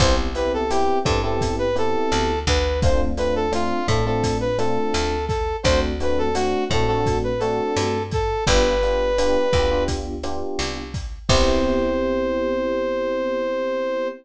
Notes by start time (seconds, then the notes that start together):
0.00 C2 B3 C4 E4 G4 C5, kick, cross-stick, closed hi-hat
0.35 B3 C4 E4 G4 B4, closed hi-hat
0.54 A4
0.70 B3 C4 E4 G4, closed hi-hat
1.04 G2 B3 C4 E4 G4 A4, kick, cross-stick, closed hi-hat
1.23 B3 C4 E4 G4 A4
1.41 kick, closed hi-hat
1.59 B4
1.75 B3 C4 E4 G4 A4, closed hi-hat
2.12 D2, cross-stick, closed hi-hat
2.47 D2 B4, kick, closed hi-hat
2.82 A3 C4 D4 F4 C5, kick, closed hi-hat
3.17 A3 C4 D4 F4 B4, closed hi-hat
3.36 A4
3.52 A3 C4 D4 F4, cross-stick, closed hi-hat
3.87 A2 A3 C4 D4 F4 A4, kick, closed hi-hat
4.06 A3 C4 D4 F4 A4
4.23 kick, closed hi-hat
4.41 B4
4.58 A3 C4 D4 F4 A4, cross-stick, closed hi-hat
4.94 D2, closed hi-hat
5.28 A4, kick, closed hi-hat
5.63 D2 A3 C4 D4 F#4 C5, kick, cross-stick, closed hi-hat
6.00 A3 C4 D4 F#4 B4, closed hi-hat
6.18 A4
6.35 A3 C4 D4 F#4, closed hi-hat
6.70 A2 A3 C4 D4 F#4 A4, kick, cross-stick, closed hi-hat
6.87 A3 C4 D4 F#4 A4
7.06 kick, closed hi-hat
7.24 B4
7.40 A3 C4 D4 F#4 A4, closed hi-hat
7.76 G2, cross-stick, closed hi-hat
8.11 A4, kick, closed hi-hat
8.47 G1 B3 D4 F4 G4 B4, kick, closed hi-hat
8.83 B3 D4 F4 G4, closed hi-hat
9.18 B3 D4 F4 G4, cross-stick, closed hi-hat
9.53 D2 B3 D4 F4 G4, kick, closed hi-hat
9.71 B3 D4 F4 G4
9.88 kick, closed hi-hat
10.23 B3 D4 F4 G4, cross-stick, closed hi-hat
10.59 C2, closed hi-hat
10.94 kick, closed hi-hat
11.29 C2 B3 C4 E4 G4 C5, kick, crash